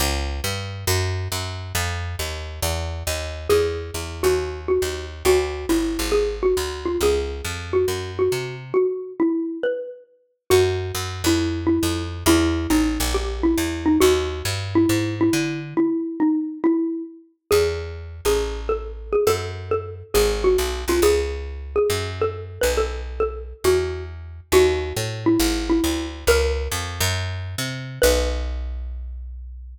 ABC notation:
X:1
M:4/4
L:1/8
Q:"Swing" 1/4=137
K:A
V:1 name="Xylophone"
z8 | z8 | G3 F2 F2 z | F2 E2 G _G2 =F |
G3 F2 F2 z | F2 E2 B2 z2 | [K:B] F3 E2 E2 z | E2 D2 =G E2 D |
F3 E2 E2 z | E2 D2 E2 z2 | [K:A] G3 G2 A2 G | A2 A2 G _G2 =F |
G3 G2 A2 B | A2 A2 F2 z2 | [K:B] F3 E2 E2 z | A4 z4 |
B8 |]
V:2 name="Electric Bass (finger)" clef=bass
C,,2 =G,,2 F,,2 F,,2 | =F,,2 ^D,,2 E,,2 D,,2 | E,,2 E,, _E,,3 E,,2 | D,,2 =G,,, ^G,,,3 D,,2 |
C,,2 =F,,2 ^F,,2 =C,2 | z8 | [K:B] F,,2 F,, =F,,3 F,,2 | E,,2 =A,,, ^A,,,3 E,,2 |
D,,2 =G,,2 ^G,,2 =D,2 | z8 | [K:A] E,,3 A,,,5 | F,,4 G,,,2 B,,, =C,, |
C,,4 F,,3 B,,,- | B,,,4 E,,4 | [K:B] D,,2 =A,,2 G,,,2 =D,,2 | C,,2 =F,, ^F,,3 =C,2 |
B,,,8 |]